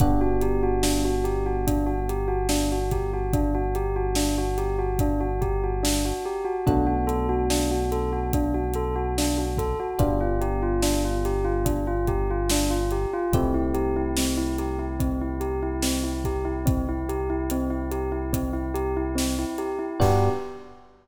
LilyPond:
<<
  \new Staff \with { instrumentName = "Tubular Bells" } { \time 4/4 \key g \major \tempo 4 = 72 d'16 fis'16 g'16 fis'16 d'16 fis'16 g'16 fis'16 d'16 fis'16 g'16 fis'16 d'16 fis'16 g'16 fis'16 | d'16 fis'16 g'16 fis'16 d'16 fis'16 g'16 fis'16 d'16 fis'16 g'16 fis'16 d'16 fis'16 g'16 fis'16 | d'16 fis'16 a'16 fis'16 d'16 fis'16 a'16 fis'16 d'16 fis'16 a'16 fis'16 d'16 fis'16 a'16 fis'16 | d'16 f'16 g'16 f'16 d'16 f'16 g'16 f'16 d'16 f'16 g'16 f'16 d'16 f'16 g'16 f'16 |
c'16 e'16 g'16 e'16 c'16 e'16 g'16 e'16 c'16 e'16 g'16 e'16 c'16 e'16 g'16 e'16 | c'16 e'16 g'16 e'16 c'16 e'16 g'16 e'16 c'16 e'16 g'16 e'16 c'16 e'16 g'16 e'16 | g'4 r2. | }
  \new Staff \with { instrumentName = "Electric Piano 1" } { \time 4/4 \key g \major <b d' fis' g'>1~ | <b d' fis' g'>1 | <a b d' fis'>1 | <b d' f' g'>1 |
<a c' e' g'>1~ | <a c' e' g'>1 | <b d' fis' g'>4 r2. | }
  \new Staff \with { instrumentName = "Synth Bass 1" } { \clef bass \time 4/4 \key g \major g,,1~ | g,,1 | b,,1 | g,,1 |
c,1~ | c,1 | g,4 r2. | }
  \new DrumStaff \with { instrumentName = "Drums" } \drummode { \time 4/4 <hh bd>8 hh8 sn8 hh8 <hh bd>8 hh8 sn8 <hh bd>8 | <hh bd>8 hh8 sn8 hh8 <hh bd>8 <hh bd>8 sn4 | <hh bd>8 hh8 sn8 hh8 <hh bd>8 hh8 sn8 <hh bd>8 | <hh bd>8 hh8 sn8 <hh sn>8 <hh bd>8 <hh bd>8 sn8 hh8 |
<hh bd>8 hh8 sn8 hh8 <hh bd>8 hh8 sn8 <hh bd>8 | <hh bd>8 hh8 hh8 hh8 <hh bd>8 hh8 sn8 hh8 | <cymc bd>4 r4 r4 r4 | }
>>